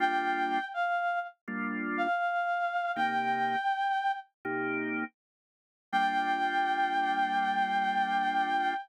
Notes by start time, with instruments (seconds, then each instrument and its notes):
0.00 drawbar organ G3 A#3 D4 F4, clarinet G5
0.74 clarinet F5
1.48 drawbar organ G3 A#3 D4 F4
1.98 clarinet F5
2.96 drawbar organ C3 A#3 D#4 G4, clarinet G5
4.45 drawbar organ C3 A#3 D#4 G4
5.92 drawbar organ G3 A#3 D4 F4, clarinet G5